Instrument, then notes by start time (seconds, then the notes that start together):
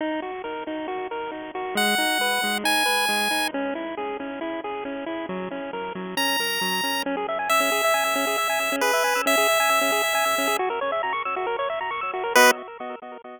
lead 1 (square)
0.01 D#4
0.22 F#4
0.44 A#4
0.67 D#4
0.88 F#4
1.11 A#4
1.31 D#4
1.55 F#4
1.75 G#3 F#5
1.98 D#4
2.21 B4
2.44 G#3
2.64 D#4 G#5
2.86 B4
3.09 G#3
3.31 D#4
3.54 C#4
3.75 E4
3.97 G#4
4.20 C#4
4.41 E4
4.64 G#4
4.85 C#4
5.06 E4
5.29 F#3
5.51 C#4
5.73 A#4
5.95 F#3
6.17 C#4 A#5
6.40 A#4
6.61 F#3
6.83 C#4
7.06 C#4
7.17 G#4
7.28 E5
7.39 G#5
7.49 E5 E6
7.60 C#4
7.72 G#4
7.84 E5
7.94 G#5
8.05 E6
8.16 C#4
8.27 G#4
8.38 E5
8.49 G#5
8.60 E6
8.72 C#4
8.81 G#4 B4
8.93 E5
9.04 G#5
9.15 E6
9.26 C#4 E5
9.37 G#4
9.49 E5
9.60 G#5
9.69 E6
9.81 C#4
9.92 G#4
10.03 E5
10.15 G#5
10.25 E6
10.38 C#4
10.47 G#4
10.59 F#4
10.70 A#4
10.81 C#5
10.92 E5
11.03 A#5
11.13 C#6
11.25 E6
11.36 F#4
11.47 A#4
11.59 C#5
11.70 E5
11.81 A#5
11.91 C#6
12.01 E6
12.14 F#4
12.24 A#4
12.35 B3 F#4 B4 D#5